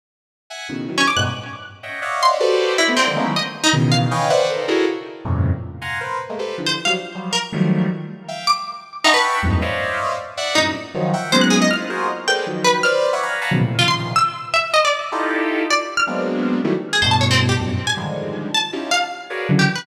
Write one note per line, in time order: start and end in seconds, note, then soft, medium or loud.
0.50 0.67 E5 medium
0.50 0.67 F#5 medium
0.50 0.67 G#5 medium
0.69 0.86 A2 soft
0.69 0.86 B2 soft
0.69 0.86 C#3 soft
0.69 0.86 D#3 soft
0.88 1.05 D#3 medium
0.88 1.05 E3 medium
0.88 1.05 F#3 medium
0.98 1.06 C#4 medium
1.08 1.16 D6 medium
1.16 1.25 G2 loud
1.16 1.25 G#2 loud
1.16 1.25 A2 loud
1.16 1.25 B2 loud
1.16 1.25 F#6 medium
1.83 2.00 C#5 soft
1.83 2.00 D#5 soft
1.83 2.00 E5 soft
1.83 2.00 F#5 soft
1.83 2.00 G5 soft
2.02 2.36 C#5 medium
2.02 2.36 D5 medium
2.02 2.36 D#5 medium
2.02 2.36 E5 medium
2.02 2.36 F5 medium
2.02 2.36 F#5 medium
2.23 2.40 C6 loud
2.40 2.74 F#4 loud
2.40 2.74 G4 loud
2.40 2.74 A4 loud
2.40 2.74 B4 loud
2.40 2.74 C5 loud
2.40 2.74 D5 loud
2.78 2.95 E4 medium
2.78 2.86 C5 medium
2.78 2.86 C#5 medium
2.78 2.86 D5 medium
2.78 2.86 D#5 medium
2.88 2.96 A3 medium
2.88 2.96 B3 medium
2.88 2.96 C4 medium
2.97 3.31 C4 medium
2.97 3.06 D5 medium
2.97 3.06 E5 medium
2.97 3.06 F#5 medium
2.97 3.06 G#5 medium
2.97 3.06 A#5 medium
3.06 3.15 D3 medium
3.06 3.15 D#3 medium
3.06 3.15 F3 medium
3.06 3.15 G3 medium
3.16 3.24 G#3 loud
3.16 3.24 A3 loud
3.16 3.24 A#3 loud
3.16 3.24 B3 loud
3.16 3.24 C#4 loud
3.16 3.24 D#4 loud
3.25 3.34 D#3 medium
3.25 3.34 E3 medium
3.25 3.34 F#3 medium
3.25 3.34 G3 medium
3.25 3.34 A3 medium
3.36 3.45 D#5 medium
3.64 3.72 D#4 loud
3.73 4.07 B2 loud
3.73 4.07 C#3 loud
3.73 4.07 D#3 loud
3.73 4.07 E3 loud
3.92 4.60 F5 medium
4.11 4.28 B4 medium
4.11 4.28 C#5 medium
4.11 4.28 D#5 medium
4.11 4.28 F5 medium
4.11 4.28 G5 medium
4.11 4.28 G#5 medium
4.30 4.47 B4 loud
4.30 4.47 C5 loud
4.30 4.47 D5 loud
4.30 4.47 E5 loud
4.30 4.47 F#5 loud
4.49 4.66 A4 medium
4.49 4.66 A#4 medium
4.49 4.66 C5 medium
4.68 4.85 E4 medium
4.68 4.85 F#4 medium
4.68 4.85 G#4 medium
4.68 4.85 A4 medium
4.68 4.85 A#4 medium
5.25 5.50 F2 medium
5.25 5.50 G2 medium
5.25 5.50 A2 medium
5.25 5.50 A#2 medium
5.25 5.50 C3 medium
5.25 5.50 C#3 medium
5.81 5.98 F5 medium
5.81 5.98 F#5 medium
5.81 5.98 G#5 medium
5.81 5.98 A#5 medium
5.81 5.98 C6 medium
6.00 6.18 A#4 medium
6.00 6.18 B4 medium
6.00 6.18 C5 medium
6.29 6.38 G#3 medium
6.29 6.38 A3 medium
6.29 6.38 A#3 medium
6.39 6.56 G4 medium
6.39 6.56 A4 medium
6.39 6.56 B4 medium
6.39 6.56 C5 medium
6.58 6.75 D3 medium
6.58 6.75 E3 medium
6.58 6.75 F3 medium
6.66 6.75 C5 medium
6.85 6.95 F3 medium
6.85 6.95 F#3 medium
6.85 6.95 G3 medium
6.85 6.94 F5 medium
7.15 7.32 F3 medium
7.15 7.32 F#3 medium
7.15 7.32 G3 medium
7.33 7.41 A#4 medium
7.52 7.87 D#3 medium
7.52 7.87 F3 medium
7.52 7.87 F#3 medium
7.52 7.87 G3 medium
7.52 7.87 A3 medium
8.28 8.45 E5 medium
8.28 8.45 F5 medium
8.28 8.45 G5 medium
8.47 8.64 D6 loud
9.04 9.13 D#4 medium
9.04 9.39 E5 medium
9.04 9.39 F#5 medium
9.04 9.39 G5 medium
9.04 9.39 A5 medium
9.04 9.39 B5 medium
9.04 9.39 C#6 medium
9.14 9.39 B4 loud
9.42 9.59 E2 medium
9.42 9.59 F#2 medium
9.42 9.59 G2 medium
9.42 9.59 G#2 medium
9.42 9.59 A2 medium
9.61 10.13 C5 medium
9.61 10.13 C#5 medium
9.61 10.13 D5 medium
9.61 10.13 D#5 medium
9.61 10.13 E5 medium
9.61 10.13 F5 medium
10.37 10.54 D5 loud
10.37 10.54 E5 loud
10.37 10.54 F#5 loud
10.55 10.73 F#2 medium
10.55 10.73 G2 medium
10.55 10.73 A2 medium
10.55 10.73 A#2 medium
10.55 10.73 C3 medium
10.55 10.72 D#4 medium
10.94 11.11 D#3 loud
10.94 11.11 F3 loud
10.94 11.11 F#3 loud
11.13 11.30 E5 medium
11.13 11.30 F#5 medium
11.13 11.30 G5 medium
11.32 11.67 F#3 loud
11.32 11.67 G#3 loud
11.32 11.67 A#3 loud
11.32 11.67 B3 loud
11.32 11.67 C#4 loud
11.32 11.67 D#4 loud
11.32 11.41 C5 loud
11.41 11.50 F#6 medium
11.50 11.59 G#4 loud
11.62 11.70 D#5 loud
11.70 11.87 D#4 medium
11.70 11.87 E4 medium
11.70 11.87 F4 medium
11.70 11.79 F6 loud
11.89 12.07 F4 medium
11.89 12.07 F#4 medium
11.89 12.07 G#4 medium
11.89 12.07 A#4 medium
11.89 12.07 C5 medium
12.28 12.45 G#4 medium
12.28 12.45 A4 medium
12.28 12.45 A#4 medium
12.28 12.45 B4 medium
12.28 12.45 C5 medium
12.28 12.45 D5 medium
12.28 12.62 G5 medium
12.46 12.81 D#3 medium
12.46 12.81 F3 medium
12.46 12.81 F#3 medium
12.64 12.81 B4 loud
12.83 13.10 B4 loud
12.83 13.10 C5 loud
12.83 13.10 D5 loud
12.83 12.92 F6 loud
13.13 13.21 C#5 medium
13.13 13.21 D5 medium
13.13 13.21 E5 medium
13.13 13.21 F#5 medium
13.22 13.39 F5 medium
13.22 13.39 F#5 medium
13.22 13.39 G#5 medium
13.22 13.39 A#5 medium
13.22 13.39 B5 medium
13.41 13.50 F5 medium
13.41 13.50 F#5 medium
13.41 13.50 G#5 medium
13.41 13.50 A5 medium
13.41 13.50 A#5 medium
13.41 13.50 B5 medium
13.51 13.59 B2 medium
13.51 13.59 C#3 medium
13.51 13.59 D#3 medium
13.51 13.59 F3 medium
13.51 13.59 F#3 medium
13.60 13.77 A2 medium
13.60 13.77 A#2 medium
13.60 13.77 C3 medium
13.79 14.13 A#2 medium
13.79 14.13 C3 medium
13.79 14.13 C#3 medium
13.79 14.13 D#3 medium
13.79 14.13 F3 medium
13.79 13.87 F4 medium
13.88 13.96 C6 medium
14.16 14.50 E6 loud
14.54 14.71 E5 medium
14.74 14.82 D#5 loud
14.85 15.10 D5 medium
15.12 15.63 D#4 loud
15.12 15.63 E4 loud
15.12 15.63 F4 loud
15.12 15.63 G4 loud
15.12 15.63 A4 loud
15.70 15.96 D5 medium
15.97 16.06 F6 medium
16.07 16.58 F#3 medium
16.07 16.58 G#3 medium
16.07 16.58 A#3 medium
16.07 16.58 B3 medium
16.07 16.58 C4 medium
16.07 16.58 D4 medium
16.64 16.73 D#3 loud
16.64 16.73 E3 loud
16.64 16.73 F#3 loud
16.64 16.73 G3 loud
16.64 16.73 A3 loud
16.93 17.01 G#4 medium
17.02 17.53 G2 loud
17.02 17.53 A2 loud
17.02 17.53 B2 loud
17.02 17.10 C5 medium
17.11 17.20 A5 medium
17.21 17.29 C#5 medium
17.31 17.39 C4 loud
17.49 17.57 G4 medium
17.59 17.76 F#2 medium
17.59 17.76 G2 medium
17.59 17.76 A2 medium
17.59 17.76 A#2 medium
17.59 17.76 B2 medium
17.87 17.95 G#5 medium
17.97 18.48 D3 medium
17.97 18.48 D#3 medium
17.97 18.48 F3 medium
17.97 18.48 G3 medium
17.97 18.48 G#3 medium
18.54 18.89 A5 medium
18.73 18.90 C#4 medium
18.73 18.90 D#4 medium
18.73 18.90 E4 medium
18.73 18.90 F4 medium
18.73 18.90 G4 medium
18.91 19.42 F5 medium
19.30 19.47 F#4 medium
19.30 19.47 G#4 medium
19.30 19.47 A#4 medium
19.30 19.47 B4 medium
19.30 19.47 C#5 medium
19.30 19.47 D5 medium
19.49 19.66 C#3 loud
19.49 19.66 D3 loud
19.49 19.66 E3 loud
19.49 19.66 F#3 loud
19.59 19.76 G4 medium
19.75 19.84 B4 medium